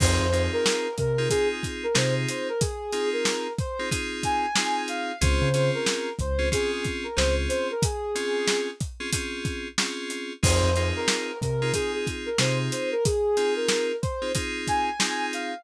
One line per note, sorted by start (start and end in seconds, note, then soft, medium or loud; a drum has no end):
0.00 0.18 F2 loud
0.00 0.26 C4 loud
0.00 0.26 D#4 loud
0.00 0.26 F4 loud
0.00 0.26 G#4 loud
0.00 0.43 C5 medium
0.00 kick loud
0.00 crash loud
0.20 0.48 F2 loud
0.32 0.87 C4 medium
0.32 0.87 D#4 medium
0.32 0.87 F4 medium
0.32 0.87 G#4 medium
0.32 closed hi-hat medium
0.53 0.95 A#4 medium
0.66 snare loud
0.98 1.28 C3 medium
0.98 1.30 A#4 medium
0.98 kick medium
0.98 closed hi-hat medium
1.18 1.29 C4 medium
1.18 1.29 D#4 medium
1.18 1.29 F4 loud
1.18 1.29 G#4 medium
1.29 1.86 C4 medium
1.29 1.86 D#4 medium
1.29 1.86 F4 medium
1.29 1.48 G#4 medium
1.29 1.86 G#4 medium
1.29 kick medium
1.29 closed hi-hat medium
1.52 1.64 G#4 medium
1.63 kick medium
1.63 closed hi-hat medium
1.83 1.96 A#4 medium
1.94 2.26 C3 medium
1.94 2.49 C4 medium
1.94 2.49 D#4 medium
1.94 2.49 F4 medium
1.94 2.49 G#4 medium
1.94 2.14 C5 medium
1.94 snare loud
2.29 2.48 C5 medium
2.29 closed hi-hat medium
2.49 2.61 A#4 medium
2.60 3.09 G#4 medium
2.60 kick medium
2.60 closed hi-hat medium
2.93 3.47 C4 medium
2.93 3.47 D#4 medium
2.93 3.47 F4 medium
2.93 3.47 G#4 medium
2.93 closed hi-hat medium
3.13 3.53 A#4 medium
3.25 snare loud
3.58 3.89 C5 medium
3.58 kick medium
3.58 closed hi-hat medium
3.79 3.90 C4 medium
3.79 3.90 D#4 medium
3.79 3.90 F4 medium
3.79 3.90 G#4 medium
3.91 4.46 C4 medium
3.91 4.46 D#4 medium
3.91 4.46 F4 medium
3.91 4.46 G#4 loud
3.91 kick medium
3.91 closed hi-hat medium
4.23 4.82 G#5 medium
4.23 kick medium
4.23 closed hi-hat medium
4.56 5.12 C4 medium
4.56 5.12 D#4 medium
4.56 5.12 F4 medium
4.56 5.12 G#4 medium
4.56 snare loud
4.88 5.19 F5 medium
4.88 closed hi-hat medium
5.21 5.40 C#2 loud
5.21 5.49 C4 medium
5.21 5.49 C#4 loud
5.21 5.49 F4 loud
5.21 5.49 G#4 loud
5.21 5.70 C5 medium
5.21 kick medium
5.21 closed hi-hat loud
5.42 5.70 C#3 loud
5.54 6.09 C4 medium
5.54 6.09 C#4 medium
5.54 6.09 F4 medium
5.54 6.09 G#4 medium
5.54 closed hi-hat medium
5.75 6.13 A#4 medium
5.86 snare loud
6.19 6.50 C#2 medium
6.19 6.49 C5 medium
6.19 kick medium
6.19 closed hi-hat medium
6.39 6.49 C4 medium
6.39 6.49 C#4 medium
6.39 6.49 F4 medium
6.39 6.49 G#4 medium
6.52 7.07 C4 loud
6.52 7.07 C#4 medium
6.52 7.07 F4 loud
6.52 7.07 G#4 medium
6.52 6.71 G#4 medium
6.52 kick medium
6.52 closed hi-hat medium
6.72 6.85 G#4 medium
6.85 kick medium
6.85 closed hi-hat medium
7.04 7.16 A#4 medium
7.17 7.47 C#2 loud
7.17 7.71 C4 medium
7.17 7.71 C#4 medium
7.17 7.71 F4 medium
7.17 7.71 G#4 loud
7.17 7.35 C5 medium
7.17 snare loud
7.49 7.68 C5 medium
7.49 closed hi-hat medium
7.71 7.83 A#4 medium
7.82 8.68 G#4 medium
7.82 kick loud
7.82 closed hi-hat loud
8.15 8.70 C4 medium
8.15 8.70 C#4 medium
8.15 8.70 F4 medium
8.15 8.70 G#4 medium
8.15 closed hi-hat medium
8.48 snare loud
8.80 kick medium
8.80 closed hi-hat medium
9.00 9.10 C4 medium
9.00 9.10 C#4 medium
9.00 9.10 F4 medium
9.00 9.10 G#4 medium
9.13 9.68 C4 medium
9.13 9.68 C#4 medium
9.13 9.68 F4 medium
9.13 9.68 G#4 medium
9.13 kick medium
9.13 closed hi-hat loud
9.45 kick medium
9.45 closed hi-hat medium
9.78 10.33 C4 medium
9.78 10.33 C#4 medium
9.78 10.33 F4 medium
9.78 10.33 G#4 medium
9.78 snare loud
10.10 closed hi-hat medium
10.43 10.61 F2 loud
10.43 10.70 C4 loud
10.43 10.70 D#4 loud
10.43 10.70 F4 loud
10.43 10.70 G#4 loud
10.43 10.87 C5 medium
10.43 kick loud
10.43 crash loud
10.63 10.92 F2 loud
10.76 11.31 C4 medium
10.76 11.31 D#4 medium
10.76 11.31 F4 medium
10.76 11.31 G#4 medium
10.76 closed hi-hat medium
10.96 11.38 A#4 medium
11.08 snare loud
11.41 11.71 C3 medium
11.41 11.73 A#4 medium
11.41 kick medium
11.41 closed hi-hat medium
11.62 11.72 C4 medium
11.62 11.72 D#4 medium
11.62 11.72 F4 loud
11.62 11.72 G#4 medium
11.74 12.29 C4 medium
11.74 12.29 D#4 medium
11.74 12.29 F4 medium
11.74 11.92 G#4 medium
11.74 12.29 G#4 medium
11.74 kick medium
11.74 closed hi-hat medium
11.94 12.06 G#4 medium
12.07 kick medium
12.07 closed hi-hat medium
12.26 12.38 A#4 medium
12.38 12.69 C3 medium
12.38 12.94 C4 medium
12.38 12.94 D#4 medium
12.38 12.94 F4 medium
12.38 12.94 G#4 medium
12.38 12.58 C5 medium
12.38 snare loud
12.71 12.90 C5 medium
12.71 closed hi-hat medium
12.92 13.04 A#4 medium
13.05 13.54 G#4 medium
13.05 kick medium
13.05 closed hi-hat medium
13.37 13.92 C4 medium
13.37 13.92 D#4 medium
13.37 13.92 F4 medium
13.37 13.92 G#4 medium
13.37 closed hi-hat medium
13.56 13.96 A#4 medium
13.68 snare loud
14.02 14.32 C5 medium
14.02 kick medium
14.02 closed hi-hat medium
14.22 14.32 C4 medium
14.22 14.32 D#4 medium
14.22 14.32 F4 medium
14.22 14.32 G#4 medium
14.35 14.90 C4 medium
14.35 14.90 D#4 medium
14.35 14.90 F4 medium
14.35 14.90 G#4 loud
14.35 kick medium
14.35 closed hi-hat medium
14.67 15.26 G#5 medium
14.67 kick medium
14.67 closed hi-hat medium
14.99 15.54 C4 medium
14.99 15.54 D#4 medium
14.99 15.54 F4 medium
14.99 15.54 G#4 medium
14.99 snare loud
15.33 15.64 F5 medium
15.33 closed hi-hat medium